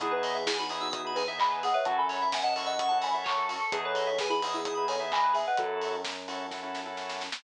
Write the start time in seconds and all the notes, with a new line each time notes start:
0.00 E2 B3 D#4 E4 G#4, kick, closed hi-hat
0.11 G#4 B4
0.23 D#5, open hi-hat
0.35 E5
0.46 E4 G#4 G#5, kick, snare
0.59 D#4 F#4 B5
0.69 B3 D#4 E4 G#4 D#6, open hi-hat
0.81 D#4 F#4 E6
0.91 B3 D#4 E4 G#4 D#6, kick, closed hi-hat
1.04 B3 D#4 E4 G#4 B5
1.15 G#4 B4 G#5, open hi-hat
1.28 B3 D#4 E4 G#4 E5
1.38 D#5 G#5 B5, kick, clap
1.51 B4
1.63 G#4 D#5 F#5, open hi-hat
1.74 B4 C#5 E5
1.85 F#2 C#4 E4 F#4 A4 F#5 A5, kick, closed hi-hat
1.98 A4 G#5 B5
2.09 C#5, open hi-hat
2.22 E5
2.32 E5 F#5 G#5, kick, snare
2.43 D#5 F#5 A5
2.56 C#4 E4 F#4 A4 C#6, open hi-hat
2.66 D#5 F#5 E6
2.79 C#4 E4 F#4 A4 C#6, kick, closed hi-hat
2.89 C#4 E4 F#4 A4 A5
3.01 F#5 G#5 B5, open hi-hat
3.14 C#4 E4 F#4 A4 E5
3.24 C#5 A5 C#6, kick, clap
3.38 A4
3.49 F#4 A5 C#6, open hi-hat
3.59 A4 A5 C#6
3.72 E2 B3 D#4 E4 G#4 B4, kick, closed hi-hat
3.85 A4 B4 C#5
3.95 D#5, open hi-hat
4.07 E5
4.18 G#4 B4 G#5, kick, snare
4.29 E4 G#4 B5
4.42 B3 D#4 E4 G#4 D#6, open hi-hat
4.54 E4 G#4 E6
4.65 B3 D#4 E4 G#4 D#6, kick, closed hi-hat
4.75 B3 D#4 E4 G#4 B5
4.88 A4 C#5 G#5, open hi-hat
5.00 B3 D#4 E4 G#4 E5
5.12 D#5 G#5 B5, kick, clap
5.23 B4
5.33 G#4 E5 G#5, open hi-hat
5.47 B4 D#5 F#5
5.57 F#2 C#4 E4 F#4 A4, kick, closed hi-hat
5.81 open hi-hat
6.05 kick, snare
6.28 C#4 E4 F#4 A4, open hi-hat
6.51 C#4 E4 F#4 A4, kick, snare
6.63 C#4 E4 F#4 A4
6.75 snare
6.86 C#4 E4 F#4 A4
6.97 snare
7.09 snare
7.21 snare
7.32 snare